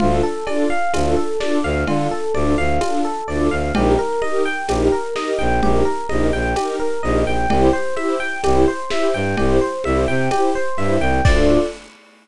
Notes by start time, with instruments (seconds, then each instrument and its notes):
0.00 violin D2, string ensemble 1 D4 F4, electric piano 1 F4, low conga
0.04 string ensemble 1 A4
0.23 electric piano 1 A4
0.46 string ensemble 1 D4 F4, electric piano 1 D5, cowbell, high conga
0.51 string ensemble 1 A4
0.70 electric piano 1 F5
0.94 violin D2, string ensemble 1 D4, electric piano 1 F4, tambourine, cowbell, high conga
0.98 string ensemble 1 F4 A4
1.16 electric piano 1 A4
1.40 string ensemble 1 D4 F4, electric piano 1 D5, snare, high conga
1.45 string ensemble 1 A4
1.63 violin D2, electric piano 1 F5
1.87 violin D3, string ensemble 1 D4 F4, electric piano 1 F4, cowbell, low conga
1.92 string ensemble 1 A4
2.11 electric piano 1 A4
2.34 violin D2, string ensemble 1 D4 F4, electric piano 1 D5, high conga
2.39 string ensemble 1 A4
2.58 violin D2, electric piano 1 F5
2.81 string ensemble 1 D4 F4, electric piano 1 F4, tambourine, cowbell, high conga
2.86 string ensemble 1 A4
3.05 electric piano 1 A4
3.28 violin D2, string ensemble 1 D4 F4, electric piano 1 D5
3.33 string ensemble 1 A4
3.51 violin D2, electric piano 1 F5
3.75 violin A#1, string ensemble 1 D#4 G4, electric piano 1 G4, cowbell, low conga
3.80 string ensemble 1 A#4
3.99 electric piano 1 A#4
4.22 string ensemble 1 D#4 G4, electric piano 1 D#5, high conga
4.28 string ensemble 1 A#4
4.45 electric piano 1 G5
4.68 violin A#1, string ensemble 1 D#4 G4, electric piano 1 G4, tambourine, cowbell, high conga
4.73 string ensemble 1 A#4
4.92 electric piano 1 A#4
5.15 string ensemble 1 D#4 G4, electric piano 1 D#5, snare, high conga
5.20 string ensemble 1 A#4
5.39 violin A#1, electric piano 1 G5
5.62 violin A#1, string ensemble 1 D#4 G4, electric piano 1 G4, low conga
5.67 string ensemble 1 A#4
5.85 electric piano 1 A#4
6.09 violin A#1, string ensemble 1 D#4 G4, electric piano 1 D#5, high conga
6.14 string ensemble 1 A#4
6.33 violin A#1, electric piano 1 G5
6.56 string ensemble 1 D#4 G4, electric piano 1 G4, tambourine, cowbell, high conga
6.62 string ensemble 1 A#4
6.80 electric piano 1 A#4
7.03 violin A#1, string ensemble 1 D#4 G4, electric piano 1 D#5
7.08 string ensemble 1 A#4
7.25 violin A#1, electric piano 1 G5
7.49 violin C2, string ensemble 1 E4 G4, electric piano 1 G4, cowbell, low conga
7.55 string ensemble 1 C5
7.73 electric piano 1 C5
7.96 string ensemble 1 E4 G4, electric piano 1 E5, high conga
8.01 string ensemble 1 C5
8.20 electric piano 1 G5
8.44 violin C2, string ensemble 1 E4, electric piano 1 G4, tambourine, cowbell, high conga
8.48 string ensemble 1 G4 C5
8.68 electric piano 1 C5
8.90 string ensemble 1 E4 G4, electric piano 1 E5, snare, high conga
8.96 string ensemble 1 C5
9.14 violin G2, electric piano 1 G5
9.37 violin C2, string ensemble 1 E4 G4, electric piano 1 G4, cowbell, low conga
9.43 string ensemble 1 C5
9.61 electric piano 1 C5
9.84 violin C2, string ensemble 1 E4 G4, electric piano 1 E5, high conga
9.90 string ensemble 1 C5
10.08 violin C3, electric piano 1 G5
10.31 string ensemble 1 E4 G4, electric piano 1 G4, tambourine, cowbell, high conga
10.36 string ensemble 1 C5
10.55 electric piano 1 C5
10.77 violin G2, string ensemble 1 E4 G4, electric piano 1 E5
10.81 string ensemble 1 C5
11.00 violin C2, electric piano 1 G5
11.25 violin D2, string ensemble 1 D4 F4, electric piano 1 D5, kick, crash
11.30 string ensemble 1 A4